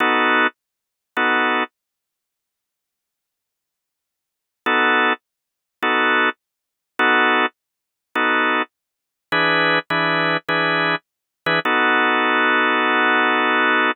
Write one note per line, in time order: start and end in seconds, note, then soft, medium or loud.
0.00 0.47 B3 loud
0.00 0.47 D#4 loud
0.00 0.47 F#4 loud
0.00 0.47 A4 loud
1.17 1.64 B3 medium
1.17 1.64 D#4 medium
1.17 1.64 F#4 medium
1.17 1.64 A4 medium
4.66 5.13 B3 loud
4.66 5.13 D#4 loud
4.66 5.13 F#4 medium
4.66 5.13 A4 loud
5.83 6.29 B3 medium
5.83 6.29 D#4 loud
5.83 6.29 F#4 loud
5.83 6.29 A4 loud
6.99 7.46 B3 loud
6.99 7.46 D#4 loud
6.99 7.46 F#4 loud
6.99 7.46 A4 loud
8.15 8.62 B3 medium
8.15 8.62 D#4 loud
8.15 8.62 F#4 medium
8.15 8.62 A4 medium
9.32 9.79 E3 medium
9.32 9.79 D4 loud
9.32 9.79 G#4 loud
9.32 9.79 B4 loud
9.90 10.37 E3 medium
9.90 10.37 D4 loud
9.90 10.37 G#4 medium
9.90 10.37 B4 medium
10.49 10.95 E3 medium
10.49 10.95 D4 medium
10.49 10.95 G#4 loud
10.49 10.95 B4 medium
11.46 11.59 E3 loud
11.46 11.59 D4 medium
11.46 11.59 G#4 loud
11.46 11.59 B4 loud
11.65 13.92 B3 medium
11.65 13.92 D#4 loud
11.65 13.92 F#4 loud
11.65 13.92 A4 medium